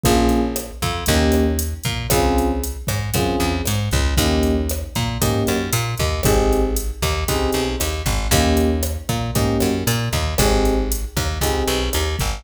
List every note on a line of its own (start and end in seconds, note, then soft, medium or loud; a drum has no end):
0.03 0.71 A#1 loud
0.03 0.41 A#3 medium
0.03 0.41 C#4 medium
0.03 0.41 F4 medium
0.03 0.41 G#4 medium
0.03 kick medium
0.03 closed hi-hat medium
0.29 closed hi-hat medium
0.56 cross-stick medium
0.56 closed hi-hat medium
0.82 1.04 F2 medium
0.82 kick medium
0.82 closed hi-hat medium
1.06 1.74 D#2 loud
1.06 1.45 A#3 medium
1.06 1.45 C#4 medium
1.06 1.45 D#4 medium
1.06 1.45 G4 medium
1.06 kick medium
1.06 closed hi-hat medium
1.32 cross-stick medium
1.32 closed hi-hat medium
1.59 closed hi-hat medium
1.84 2.07 A#2 medium
1.84 kick medium
1.84 closed hi-hat medium
2.10 2.77 C#2 medium
2.10 2.47 C4 medium
2.10 2.47 C#4 medium
2.10 2.47 F4 medium
2.10 2.47 G#4 medium
2.10 kick medium
2.10 cross-stick loud
2.10 closed hi-hat medium
2.38 closed hi-hat medium
2.63 closed hi-hat medium
2.87 3.10 G#2 medium
2.87 kick medium
2.87 cross-stick medium
2.87 closed hi-hat medium
3.14 3.36 F#2 medium
3.14 3.52 C4 medium
3.14 3.52 C#4 medium
3.14 3.52 F4 medium
3.14 3.52 G#4 medium
3.14 kick medium
3.14 closed hi-hat medium
3.40 3.62 E2 medium
3.40 closed hi-hat medium
3.65 3.89 G#2 medium
3.65 cross-stick medium
3.65 closed hi-hat medium
3.91 4.15 C#2 medium
3.91 kick medium
3.91 closed hi-hat soft
4.17 4.83 D#2 loud
4.17 4.54 A#3 medium
4.17 4.54 C#4 medium
4.17 4.54 D#4 medium
4.17 4.54 G4 medium
4.17 kick medium
4.17 closed hi-hat medium
4.43 closed hi-hat medium
4.69 cross-stick medium
4.69 closed hi-hat medium
4.95 5.18 A#2 medium
4.95 kick medium
4.95 closed hi-hat medium
5.21 5.43 G#2 medium
5.21 5.58 A#3 medium
5.21 5.58 C#4 medium
5.21 5.58 D#4 medium
5.21 5.58 G4 medium
5.21 kick medium
5.21 closed hi-hat medium
5.47 5.70 F#2 medium
5.47 cross-stick medium
5.47 closed hi-hat medium
5.73 5.95 A#2 loud
5.73 closed hi-hat medium
5.98 6.21 D#2 medium
5.98 kick medium
5.98 closed hi-hat medium
6.23 6.91 G#1 medium
6.23 6.61 C4 medium
6.23 6.61 D#4 medium
6.23 6.61 G4 medium
6.23 6.61 G#4 medium
6.23 kick medium
6.23 cross-stick medium
6.23 closed hi-hat medium
6.52 closed hi-hat medium
6.76 closed hi-hat medium
7.02 7.24 D#2 medium
7.02 kick medium
7.02 cross-stick medium
7.02 closed hi-hat medium
7.28 7.50 C#2 medium
7.28 7.64 C4 medium
7.28 7.64 D#4 medium
7.28 7.64 G4 medium
7.28 7.64 G#4 medium
7.28 kick medium
7.28 closed hi-hat medium
7.52 7.76 B1 medium
7.52 closed hi-hat medium
7.80 8.02 D#2 medium
7.80 cross-stick medium
7.80 closed hi-hat medium
8.06 8.28 G#1 medium
8.06 kick medium
8.06 closed hi-hat medium
8.31 8.97 D#2 loud
8.31 8.69 A#3 medium
8.31 8.69 C#4 medium
8.31 8.69 D#4 medium
8.31 8.69 G4 medium
8.31 kick medium
8.31 closed hi-hat medium
8.57 closed hi-hat medium
8.83 cross-stick medium
8.83 closed hi-hat medium
9.09 9.31 A#2 medium
9.09 kick medium
9.09 closed hi-hat medium
9.35 9.57 G#2 medium
9.35 9.71 A#3 medium
9.35 9.71 C#4 medium
9.35 9.71 D#4 medium
9.35 9.71 G4 medium
9.35 kick medium
9.35 closed hi-hat medium
9.60 9.84 F#2 medium
9.60 cross-stick medium
9.60 closed hi-hat medium
9.87 10.09 A#2 loud
9.87 closed hi-hat medium
10.13 10.35 D#2 medium
10.13 kick medium
10.13 closed hi-hat medium
10.38 11.05 G#1 loud
10.38 10.75 C4 medium
10.38 10.75 D#4 medium
10.38 10.75 G4 medium
10.38 10.75 G#4 medium
10.38 kick medium
10.38 cross-stick medium
10.38 closed hi-hat medium
10.65 closed hi-hat medium
10.92 closed hi-hat medium
11.16 11.38 D#2 medium
11.16 kick medium
11.16 cross-stick medium
11.16 closed hi-hat medium
11.41 11.63 C#2 medium
11.41 11.79 C4 medium
11.41 11.79 D#4 medium
11.41 11.79 G4 medium
11.41 11.79 G#4 medium
11.41 kick medium
11.41 closed hi-hat medium
11.67 11.89 B1 medium
11.67 closed hi-hat medium
11.93 12.16 D#2 medium
11.93 cross-stick medium
11.93 closed hi-hat medium
12.19 12.42 G#1 medium
12.19 kick medium
12.19 closed hi-hat medium